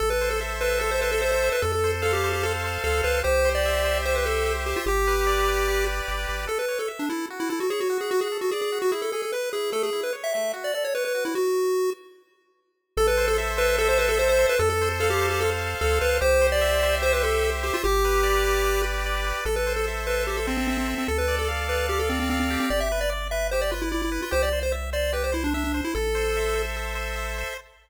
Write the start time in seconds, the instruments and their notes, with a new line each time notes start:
0.00 synth bass 1 A1, lead 1 (square) A4
0.10 lead 1 (square) B4
0.21 lead 1 (square) C5
0.30 lead 1 (square) A4
0.41 lead 1 (square) E5
0.60 lead 1 (square) B4 C5
0.79 lead 1 (square) A4
0.91 lead 1 (square) C5
1.01 lead 1 (square) B4 C5
1.11 lead 1 (square) A4
1.22 lead 1 (square) C5 E5
1.32 lead 1 (square) C5
1.44 lead 1 (square) C5
1.52 lead 1 (square) B4
1.62 synth bass 1 F2, lead 1 (square) A4
1.72 lead 1 (square) A4
1.84 lead 1 (square) C5
2.02 lead 1 (square) A4 F5
2.13 lead 1 (square) G4
2.23 lead 1 (square) C5
2.33 lead 1 (square) G4
2.43 lead 1 (square) A4
2.64 lead 1 (square) C5
2.84 synth bass 1 D2, lead 1 (square) A4 F5
3.03 synth bass 1 C#2, lead 1 (square) B4 C5
3.24 synth bass 1 C2, lead 1 (square) G4 C5
3.45 lead 1 (square) C5
3.55 lead 1 (square) D5
3.66 lead 1 (square) E5
3.84 lead 1 (square) C5
4.05 lead 1 (square) G4 C5
4.16 lead 1 (square) B4
4.26 lead 1 (square) A4 C5
4.46 lead 1 (square) E5
4.66 lead 1 (square) G4 C5
4.76 lead 1 (square) F4
4.86 synth bass 1 G1, lead 1 (square) G4
5.07 lead 1 (square) B4
5.27 lead 1 (square) D5
5.48 lead 1 (square) B4
5.68 lead 1 (square) G4
5.86 lead 1 (square) B4
6.08 synth bass 1 G1, lead 1 (square) D5
6.28 synth bass 1 G#1, lead 1 (square) B4
6.47 lead 1 (square) A4
6.59 lead 1 (square) B4
6.68 lead 1 (square) C#5
6.79 lead 1 (square) A4
6.88 lead 1 (square) E5
6.99 lead 1 (square) D4
7.09 lead 1 (square) E4 A4
7.30 lead 1 (square) F#4
7.40 lead 1 (square) E4
7.49 lead 1 (square) E4 A4
7.60 lead 1 (square) F#4
7.70 lead 1 (square) G#4 C#5
7.80 lead 1 (square) F#4
7.90 lead 1 (square) F#4
8.01 lead 1 (square) G#4
8.11 lead 1 (square) F#4
8.21 lead 1 (square) G#4
8.32 lead 1 (square) A4
8.41 lead 1 (square) F#4
8.51 lead 1 (square) G#4 D5
8.61 lead 1 (square) G#4
8.72 lead 1 (square) F#4
8.82 lead 1 (square) F#4
8.92 lead 1 (square) E4 G#4
9.02 lead 1 (square) A4
9.12 lead 1 (square) G#4 A4
9.22 lead 1 (square) A4
9.32 lead 1 (square) B4
9.53 lead 1 (square) E4 G#4
9.72 lead 1 (square) A3 A4
9.83 lead 1 (square) G#4
9.93 lead 1 (square) E4
10.03 lead 1 (square) B4
10.13 lead 1 (square) C#5
10.24 lead 1 (square) E5
10.34 lead 1 (square) A3 E5
10.53 lead 1 (square) F#4
10.64 lead 1 (square) D5
10.74 lead 1 (square) A4 D5
10.84 lead 1 (square) C#5
10.95 lead 1 (square) B4 C#5
11.05 lead 1 (square) B4
11.15 lead 1 (square) F#4
11.25 lead 1 (square) E4
11.35 lead 1 (square) F#4
12.97 synth bass 1 A1, lead 1 (square) A4
13.07 lead 1 (square) B4
13.17 lead 1 (square) C5
13.28 lead 1 (square) A4
13.38 lead 1 (square) E5
13.57 lead 1 (square) B4 C5
13.78 lead 1 (square) A4
13.89 lead 1 (square) C5
13.98 lead 1 (square) B4 C5
14.09 lead 1 (square) A4
14.17 lead 1 (square) C5 E5
14.29 lead 1 (square) C5
14.39 lead 1 (square) C5
14.49 lead 1 (square) B4
14.59 synth bass 1 F2, lead 1 (square) A4
14.70 lead 1 (square) A4
14.82 lead 1 (square) C5
15.00 lead 1 (square) A4 F5
15.10 lead 1 (square) G4
15.21 lead 1 (square) C5
15.30 lead 1 (square) G4
15.41 lead 1 (square) A4
15.61 lead 1 (square) C5
15.81 synth bass 1 D2, lead 1 (square) A4 F5
16.01 synth bass 1 C#2, lead 1 (square) B4 C5
16.21 synth bass 1 C2, lead 1 (square) G4 C5
16.41 lead 1 (square) C5
16.52 lead 1 (square) D5
16.61 lead 1 (square) E5
16.83 lead 1 (square) C5
17.02 lead 1 (square) G4 C5
17.13 lead 1 (square) B4
17.23 lead 1 (square) A4 C5
17.44 lead 1 (square) E5
17.63 lead 1 (square) G4 C5
17.74 lead 1 (square) F4
17.84 synth bass 1 G1, lead 1 (square) G4
18.05 lead 1 (square) B4
18.23 lead 1 (square) D5
18.45 lead 1 (square) B4
18.64 lead 1 (square) G4
18.84 lead 1 (square) B4
19.06 lead 1 (square) D5
19.27 lead 1 (square) B4
19.45 synth bass 1 A1, lead 1 (square) A4
19.56 lead 1 (square) B4
19.67 lead 1 (square) C5
19.76 lead 1 (square) A4
19.88 lead 1 (square) E5
20.07 lead 1 (square) B4 C5
20.27 lead 1 (square) G4 A4
20.37 lead 1 (square) A4
20.47 lead 1 (square) C4 C5
20.57 lead 1 (square) C4
20.68 lead 1 (square) C4 E5
20.78 lead 1 (square) C4
20.88 lead 1 (square) C5
20.98 lead 1 (square) C4
21.08 synth bass 1 D2, lead 1 (square) A4
21.18 lead 1 (square) B4
21.28 lead 1 (square) D5
21.39 lead 1 (square) A4
21.48 lead 1 (square) F5
21.68 lead 1 (square) B4 D5
21.89 lead 1 (square) G4 A4
21.99 lead 1 (square) A4
22.09 lead 1 (square) C4 D5
22.20 lead 1 (square) C4
22.30 lead 1 (square) C4 F5
22.40 lead 1 (square) C4
22.50 lead 1 (square) G4
22.60 lead 1 (square) C4
22.70 synth bass 1 G1, lead 1 (square) D5
22.80 lead 1 (square) E5
22.92 lead 1 (square) B4
23.01 lead 1 (square) D5
23.10 lead 1 (square) D5
23.31 lead 1 (square) B4 E5
23.51 lead 1 (square) G4 C5
23.61 lead 1 (square) D5
23.71 lead 1 (square) F4 B4
23.82 lead 1 (square) E4
23.92 lead 1 (square) E4 D5
24.02 lead 1 (square) E4
24.12 lead 1 (square) B4
24.22 lead 1 (square) F4
24.31 synth bass 1 C2, lead 1 (square) G4 C5
24.43 lead 1 (square) D5
24.53 lead 1 (square) C5
24.63 lead 1 (square) C5
24.72 lead 1 (square) E5
24.93 lead 1 (square) C5 D5
25.13 lead 1 (square) G4 B4
25.24 lead 1 (square) C5
25.32 lead 1 (square) E4 C5
25.44 lead 1 (square) D4
25.54 lead 1 (square) D4 E5
25.64 lead 1 (square) D4
25.74 lead 1 (square) C5
25.84 lead 1 (square) E4
25.95 synth bass 1 A1, lead 1 (square) A4
26.15 lead 1 (square) C5
26.37 lead 1 (square) E5
26.55 lead 1 (square) C5
26.77 lead 1 (square) A4
26.95 lead 1 (square) C5
27.16 lead 1 (square) E5
27.38 lead 1 (square) C5